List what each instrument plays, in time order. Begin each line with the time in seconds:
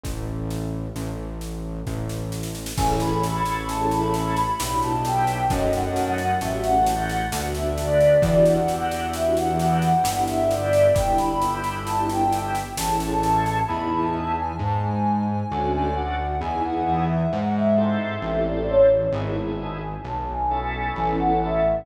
0.03 synth bass 1 A1, kick, snare
0.50 snare
0.96 synth bass 1 A1, snare
1.41 snare
1.87 synth bass 1 A1, kick, snare
2.09 snare
2.32 snare
2.43 snare
2.55 snare
2.66 snare
2.77 synth bass 1 A1, drawbar organ C#4 E4 G#4 A4, ocarina G#5, kick, snare, crash
3.00 ocarina B5, snare
3.23 snare
3.45 ocarina B5, snare
3.69 ocarina A5, snare
3.91 ocarina B5, snare
4.14 snare
4.36 ocarina B5, snare
4.60 synth bass 1 B1, drawbar organ B3 D4 E4 G4, snare
4.82 ocarina A5, snare
5.04 ocarina G5, snare
5.27 snare
5.50 synth bass 1 F#2, drawbar organ A3 C#4 D#4 F#4, ocarina D#5, kick, snare
5.73 ocarina F#5, snare
5.96 snare
6.18 ocarina F#5, snare
6.41 synth bass 1 A1, drawbar organ A3 C#4 F#4 G4, ocarina E5, snare
6.64 ocarina F#5, snare
6.86 snare
7.09 ocarina F#5, snare
7.32 synth bass 1 D2, drawbar organ A3 B3 D4 F#4, snare
7.55 ocarina E5, snare
7.77 ocarina D5, snare
8.00 snare
8.22 synth bass 1 E2, drawbar organ D4 E4 F#4 G4, ocarina D5, kick, snare
8.45 ocarina F#5, snare
8.68 snare
8.91 ocarina F#5, snare
9.13 ocarina E5, snare
9.35 ocarina F#5, snare
9.59 snare
9.82 ocarina F#5, snare
10.04 synth bass 1 G1, drawbar organ B3 D4 E4 G4, snare
10.27 ocarina E5, snare
10.51 ocarina D5, snare
10.73 snare
10.94 synth bass 1 G1, drawbar organ B3 D4 E4 G4, ocarina G5, kick, snare
11.17 ocarina B5, snare
11.41 snare
11.64 ocarina B5, snare
11.85 ocarina A5, snare
12.09 ocarina G5, snare
12.32 snare
12.55 snare
12.77 synth bass 1 A1, drawbar organ A3 C#4 E4 G#4, ocarina A5, snare
13.00 snare
13.23 snare
13.46 snare
13.67 synth bass 1 E2, drawbar organ B3 D#4 E4 G#4, ocarina B5
13.91 ocarina A5
14.36 ocarina G#5
14.59 synth bass 1 G#2, ocarina A5
14.82 ocarina G#5
15.29 ocarina G#5
15.51 synth bass 1 D2, drawbar organ C#4 D4 F#4 A4
15.72 ocarina G#5
15.96 ocarina F#5
16.41 synth bass 1 E2, drawbar organ B3 D#4 E4 G#4, ocarina G#5
16.63 ocarina F#5
17.09 ocarina E5
17.31 synth bass 1 G#2, ocarina F#5
17.55 ocarina E5
17.77 drawbar organ C4 E4 G4 A4
17.99 ocarina E5
18.22 synth bass 1 A1
18.45 ocarina D5
18.70 ocarina C#5
19.12 synth bass 1 G#1, drawbar organ B3 D#4 E4 G#4, ocarina B5
19.36 ocarina A5
19.81 ocarina G#5
20.04 synth bass 1 B1, ocarina A5
20.29 ocarina G#5
20.51 drawbar organ B3 C#4 E4 A4
20.73 ocarina G#5
20.95 synth bass 1 A1
21.19 ocarina F#5
21.41 ocarina E5